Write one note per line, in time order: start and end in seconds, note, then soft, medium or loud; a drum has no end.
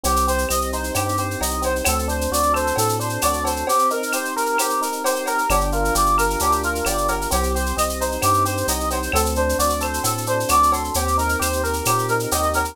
0.04 0.46 C2 medium
0.04 0.48 C4 medium
0.04 0.25 G4 medium
0.04 cowbell medium
0.04 shaker medium
0.16 shaker medium
0.27 1.18 G4 medium
0.27 0.48 C5 medium
0.27 shaker medium
0.38 shaker medium
0.49 0.91 C2 medium
0.49 0.96 C4 medium
0.49 0.71 D#5 medium
0.49 claves medium
0.49 shaker medium
0.61 shaker medium
0.72 1.41 D#4 medium
0.72 0.93 C5 medium
0.72 shaker medium
0.84 shaker medium
0.95 1.36 G2 medium
0.95 1.61 C4 medium
0.95 1.16 G4 medium
0.95 cowbell medium
0.95 claves medium
0.95 shaker medium
1.09 shaker medium
1.17 1.83 G4 medium
1.17 1.39 C5 medium
1.17 shaker medium
1.31 shaker medium
1.41 1.82 C2 medium
1.41 1.84 D#4 medium
1.41 1.62 D#5 medium
1.41 cowbell medium
1.41 shaker medium
1.50 shaker medium
1.62 1.83 C4 medium
1.62 1.84 C5 medium
1.62 cowbell medium
1.62 shaker medium
1.76 shaker medium
1.85 2.28 D2 medium
1.85 2.75 C4 medium
1.85 2.07 A4 medium
1.85 cowbell medium
1.85 claves loud
1.85 shaker medium
1.99 shaker medium
2.08 2.99 D4 medium
2.08 2.30 C5 medium
2.08 shaker medium
2.21 shaker medium
2.31 2.72 D2 medium
2.31 3.22 F#4 medium
2.31 2.53 D5 medium
2.31 shaker medium
2.43 shaker medium
2.53 3.43 A4 medium
2.53 2.75 C5 medium
2.53 claves medium
2.53 shaker medium
2.67 shaker medium
2.76 3.18 A2 medium
2.76 3.62 C4 medium
2.76 2.98 A4 medium
2.76 cowbell medium
2.76 shaker medium
2.89 shaker medium
3.00 3.64 D4 medium
3.00 3.21 C5 medium
3.00 shaker medium
3.09 shaker medium
3.21 3.64 D2 medium
3.21 3.66 F#4 medium
3.21 3.43 D5 medium
3.21 cowbell medium
3.21 claves medium
3.21 shaker medium
3.33 shaker medium
3.44 3.66 A4 medium
3.44 3.66 C5 medium
3.44 cowbell medium
3.44 shaker medium
3.56 shaker medium
3.67 4.58 C4 medium
3.67 3.89 G4 medium
3.67 cowbell medium
3.67 shaker medium
3.79 shaker medium
3.90 4.81 D#4 medium
3.90 4.12 A#4 medium
3.90 shaker medium
4.03 shaker medium
4.12 5.05 G4 medium
4.12 4.34 C5 medium
4.12 claves medium
4.12 shaker medium
4.25 shaker medium
4.36 4.57 A#4 medium
4.36 5.27 A#4 medium
4.36 shaker medium
4.46 shaker medium
4.58 5.45 C4 medium
4.58 4.80 G4 medium
4.58 cowbell medium
4.58 claves medium
4.58 shaker medium
4.70 shaker medium
4.81 5.46 D#4 medium
4.81 5.03 A#4 medium
4.81 shaker medium
4.92 shaker medium
5.04 5.48 G4 medium
5.04 5.25 C5 medium
5.04 cowbell medium
5.04 shaker medium
5.15 shaker medium
5.26 5.48 A#4 medium
5.26 5.49 A#4 medium
5.26 cowbell medium
5.26 shaker medium
5.38 shaker medium
5.50 5.91 G1 loud
5.50 6.40 D4 medium
5.50 5.71 G4 medium
5.50 cowbell medium
5.50 claves medium
5.50 shaker medium
5.61 shaker medium
5.72 6.64 F4 medium
5.72 5.94 A#4 medium
5.72 shaker medium
5.85 shaker medium
5.95 6.36 G1 medium
5.95 6.86 G4 medium
5.95 6.16 D5 medium
5.95 shaker medium
6.06 shaker medium
6.18 7.08 A#4 medium
6.18 6.39 A#4 medium
6.18 claves medium
6.18 shaker medium
6.30 shaker medium
6.39 6.82 D2 medium
6.39 7.27 D4 medium
6.39 6.61 G4 medium
6.39 cowbell medium
6.39 shaker medium
6.52 shaker medium
6.63 7.29 F4 medium
6.63 6.85 A#4 medium
6.63 shaker medium
6.75 shaker medium
6.85 7.27 G1 medium
6.85 7.29 G4 medium
6.85 7.07 D5 medium
6.85 cowbell medium
6.85 claves medium
6.85 shaker medium
6.98 shaker medium
7.08 7.30 A#4 medium
7.08 cowbell medium
7.08 shaker medium
7.21 shaker medium
7.30 7.73 C2 loud
7.30 7.76 C4 medium
7.30 7.53 G4 medium
7.30 cowbell medium
7.30 shaker medium
7.43 shaker medium
7.54 8.45 G4 medium
7.54 7.75 C5 medium
7.54 shaker medium
7.66 shaker medium
7.76 8.18 C2 medium
7.76 8.23 C4 medium
7.76 7.98 D#5 medium
7.76 claves medium
7.76 shaker medium
7.89 shaker medium
8.00 8.68 D#4 medium
8.00 8.21 C5 medium
8.00 shaker medium
8.12 shaker medium
8.22 8.63 G2 medium
8.22 8.90 C4 medium
8.22 8.44 G4 medium
8.22 cowbell medium
8.22 claves medium
8.22 shaker medium
8.34 shaker medium
8.45 9.10 G4 medium
8.45 8.66 C5 medium
8.45 shaker medium
8.57 shaker medium
8.68 9.09 C2 medium
8.68 9.12 D#4 medium
8.68 8.89 D#5 medium
8.68 cowbell medium
8.68 shaker medium
8.80 shaker medium
8.90 9.12 C4 medium
8.90 9.12 C5 medium
8.90 cowbell medium
8.90 shaker medium
9.03 shaker medium
9.12 9.54 D2 loud
9.12 10.03 C4 medium
9.12 9.34 A4 medium
9.12 cowbell medium
9.12 claves medium
9.12 shaker medium
9.26 shaker medium
9.35 10.27 D4 medium
9.35 9.57 C5 medium
9.35 shaker medium
9.49 shaker medium
9.59 10.00 D2 medium
9.59 10.48 F#4 medium
9.59 9.80 D5 medium
9.59 shaker medium
9.69 shaker medium
9.80 10.72 A4 medium
9.80 10.02 C5 medium
9.80 claves medium
9.80 shaker medium
9.93 shaker medium
10.04 10.45 A2 medium
10.04 10.90 C4 medium
10.04 10.25 A4 medium
10.04 cowbell medium
10.04 shaker medium
10.18 shaker medium
10.26 10.92 D4 medium
10.26 10.48 C5 medium
10.26 shaker medium
10.40 shaker medium
10.49 10.90 D2 medium
10.49 10.92 F#4 medium
10.49 10.71 D5 medium
10.49 cowbell medium
10.49 claves medium
10.49 shaker medium
10.63 shaker medium
10.72 10.94 A4 medium
10.72 10.93 C6 medium
10.72 cowbell medium
10.72 shaker medium
10.84 shaker soft
10.94 11.36 D#2 medium
10.94 11.87 C4 medium
10.94 11.16 G4 medium
10.94 cowbell medium
10.94 shaker medium
11.08 shaker medium
11.17 12.10 D#4 medium
11.17 11.39 A#4 medium
11.17 shaker medium
11.29 shaker medium
11.39 11.82 D#2 medium
11.39 12.32 G4 medium
11.39 11.62 C5 medium
11.39 claves medium
11.39 shaker medium
11.53 shaker medium
11.63 11.84 A#4 medium
11.63 12.55 A#4 medium
11.63 shaker medium
11.73 shaker medium
11.85 12.27 A#2 medium
11.85 12.74 C4 medium
11.85 12.07 G4 medium
11.85 cowbell medium
11.85 claves medium
11.85 shaker medium
11.98 shaker medium
12.08 12.75 D#4 medium
12.08 12.30 A#4 medium
12.08 shaker medium
12.20 shaker medium
12.31 12.73 D#2 medium
12.31 12.75 G4 medium
12.31 12.53 D#5 medium
12.31 cowbell medium
12.31 shaker medium
12.43 shaker medium
12.53 12.75 A#4 medium
12.53 12.76 A#4 medium
12.53 cowbell medium
12.53 shaker medium
12.65 shaker medium